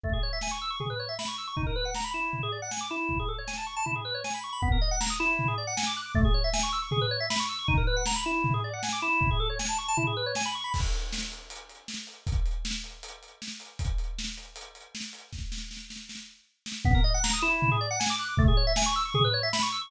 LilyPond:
<<
  \new Staff \with { instrumentName = "Drawbar Organ" } { \time 4/4 \key b \mixolydian \tempo 4 = 157 a16 gis'16 cis''16 e''16 gis''16 cis'''16 e'''16 cis'''16 gis'16 b'16 cis''16 e''16 b''16 cis'''16 e'''16 cis'''16 | dis'16 ais'16 b'16 fis''16 ais''16 b''16 e'8. gis'16 d''16 fis''16 gis''16 d'''16 e'8~ | e'16 gis'16 a'16 cis''16 gis''16 a''16 cis'''16 a''16 e'16 gis'16 b'16 cis''16 gis''16 b''16 cis'''16 b''16 | b16 ais'16 dis''16 fis''16 ais''16 dis'''16 e'8. gis'16 d''16 fis''16 gis''16 d'''16 fis'''16 d'''16 |
a16 gis'16 cis''16 e''16 gis''16 cis'''16 e'''16 cis'''16 gis'16 b'16 cis''16 e''16 b''16 cis'''16 e'''16 cis'''16 | dis'16 ais'16 b'16 fis''16 ais''16 b''16 e'8. gis'16 d''16 fis''16 gis''16 d'''16 e'8~ | e'16 gis'16 a'16 cis''16 gis''16 a''16 cis'''16 a''16 e'16 gis'16 b'16 cis''16 gis''16 b''16 cis'''16 b''16 | r1 |
r1 | r1 | r1 | b16 ais'16 dis''16 fis''16 ais''16 dis'''16 e'8. gis'16 d''16 fis''16 gis''16 d'''16 fis'''16 d'''16 |
a16 gis'16 cis''16 e''16 gis''16 cis'''16 e'''16 cis'''16 gis'16 b'16 cis''16 e''16 b''16 cis'''16 e'''16 cis'''16 | }
  \new DrumStaff \with { instrumentName = "Drums" } \drummode { \time 4/4 <bd tomfh>4 sn4 tomfh4 sn4 | <bd tomfh>4 sn4 tomfh4 sn4 | <bd tomfh>4 sn4 tomfh4 sn4 | <bd tomfh>4 sn4 tomfh4 sn4 |
<bd tomfh>4 sn4 tomfh4 sn4 | <bd tomfh>4 sn4 tomfh4 sn4 | <bd tomfh>4 sn4 tomfh4 sn4 | <cymc bd>8 hh8 sn8 hh8 hh8 hh8 sn8 hh8 |
<hh bd>8 hh8 sn8 hh8 hh8 hh8 sn8 hh8 | <hh bd>8 hh8 sn8 hh8 hh8 hh8 sn8 hh8 | <bd sn>8 sn8 sn8 sn8 sn4 r8 sn8 | <bd tomfh>4 sn4 tomfh4 sn4 |
<bd tomfh>4 sn4 tomfh4 sn4 | }
>>